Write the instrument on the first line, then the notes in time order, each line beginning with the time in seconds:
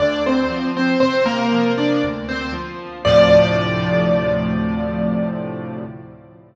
acoustic grand piano
0.00 D2 D4 D5
0.26 C4 C5
0.50 F3
0.77 C4 C5
1.00 C3 C4 C5
1.26 A#3 A#4
1.52 F3
1.78 D4 D5
2.04 D2
2.29 C4 C5
2.53 F3
3.05 D2 A2 C3 F3 D5